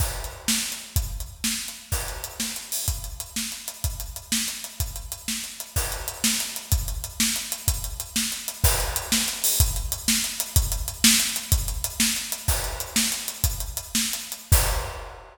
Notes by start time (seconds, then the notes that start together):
0.00 kick, crash
0.24 closed hi-hat
0.48 snare
0.72 closed hi-hat
0.96 kick, closed hi-hat
1.20 closed hi-hat
1.44 snare
1.68 closed hi-hat
1.92 kick, crash
2.08 closed hi-hat
2.24 closed hi-hat
2.40 snare
2.56 closed hi-hat
2.72 open hi-hat
2.88 kick, closed hi-hat
3.04 closed hi-hat
3.20 closed hi-hat
3.36 snare
3.52 closed hi-hat
3.68 closed hi-hat
3.84 kick, closed hi-hat
4.00 closed hi-hat
4.16 closed hi-hat
4.32 snare
4.48 closed hi-hat
4.64 closed hi-hat
4.80 kick, closed hi-hat
4.96 closed hi-hat
5.12 closed hi-hat
5.28 snare
5.44 closed hi-hat
5.60 closed hi-hat
5.76 kick, crash
5.92 closed hi-hat
6.08 closed hi-hat
6.24 snare
6.40 closed hi-hat
6.56 closed hi-hat
6.72 kick, closed hi-hat
6.88 closed hi-hat
7.04 closed hi-hat
7.20 snare
7.36 closed hi-hat
7.52 closed hi-hat
7.68 kick, closed hi-hat
7.84 closed hi-hat
8.00 closed hi-hat
8.16 snare
8.32 closed hi-hat
8.48 closed hi-hat
8.64 kick, crash
8.80 closed hi-hat
8.96 closed hi-hat
9.12 snare
9.28 closed hi-hat
9.44 open hi-hat
9.60 kick, closed hi-hat
9.76 closed hi-hat
9.92 closed hi-hat
10.08 snare
10.24 closed hi-hat
10.40 closed hi-hat
10.56 kick, closed hi-hat
10.72 closed hi-hat
10.88 closed hi-hat
11.04 snare
11.20 closed hi-hat
11.36 closed hi-hat
11.52 kick, closed hi-hat
11.68 closed hi-hat
11.84 closed hi-hat
12.00 snare
12.16 closed hi-hat
12.32 closed hi-hat
12.48 kick, crash
12.64 closed hi-hat
12.80 closed hi-hat
12.96 snare
13.12 closed hi-hat
13.28 closed hi-hat
13.44 kick, closed hi-hat
13.60 closed hi-hat
13.77 closed hi-hat
13.95 snare
14.13 closed hi-hat
14.32 closed hi-hat
14.52 kick, crash